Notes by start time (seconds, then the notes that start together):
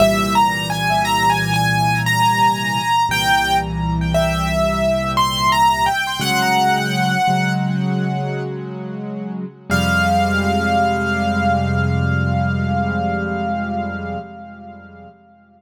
0.00 C2 A#2 E3 G3 E5
0.35 A#5
0.70 G#5
1.05 A#5
1.30 G#5
1.54 G#5
2.06 A#5
3.09 C2 A#2 E3 G3 G5
4.14 E5
5.17 C6
5.52 A#5
5.86 G5
6.20 C#3 F#3 G#3 F#5
7.28 C#3 F#3 G#3
9.70 F2 C3 G3 G#3 F5